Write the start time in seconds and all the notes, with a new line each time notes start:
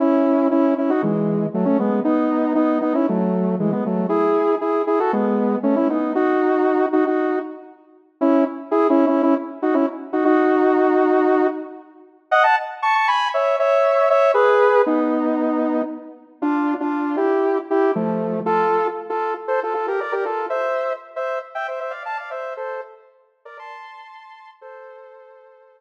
0.00 C#4 E4
0.51 C#4 E4
0.78 C#4 E4
0.90 D#4 F#4
1.03 E3 G#3
1.54 F#3 A3
1.65 A3 C#4
1.79 G#3 B3
2.04 B3 D#4
2.55 B3 D#4
2.81 B3 D#4
2.94 C#4 E4
3.09 F#3 A3
3.60 E3 G#3
3.72 G#3 B3
3.86 F#3 A3
4.09 E4 G#4
4.61 E4 G#4
4.87 E4 G#4
5.00 F#4 A4
5.13 G#3 B3
5.63 A3 C#4
5.76 C#4 E4
5.90 B3 D#4
6.15 D#4 F#4
6.93 D#4 F#4
7.07 D#4 F#4
8.21 C#4 E4
8.71 E4 G#4
8.90 C#4 E4
9.07 C#4 E4
9.23 C#4 E4
9.62 D#4 F#4
9.74 C#4 E4
10.13 D#4 F#4
10.25 D#4 F#4
12.31 D#5 F#5
12.43 F#5 A5
12.82 A5 C#6
12.95 A5 C#6
13.08 G#5 B5
13.34 C#5 E5
13.59 C#5 E5
14.10 C#5 E5
14.34 G#4 B4
14.86 B3 D#4
16.42 D4 F4
16.80 D4 F4
17.17 E4 G4
17.70 E4 G4
17.95 F3 A3
18.46 F4 A4
19.10 F4 A4
19.48 A4 C5
19.63 F4 A4
19.74 F4 A4
19.88 G4 A#4
20.01 A#4 D5
20.12 G4 A#4
20.25 F4 A4
20.50 C5 E5
21.16 C5 E5
21.55 E5 G5
21.68 C5 E5
21.80 C5 E5
21.90 D5 F5
22.05 F5 A5
22.17 D5 F5
22.31 C5 E5
22.57 A4 C5
23.45 A#4 D5
23.59 A5 C6
24.61 A4 C5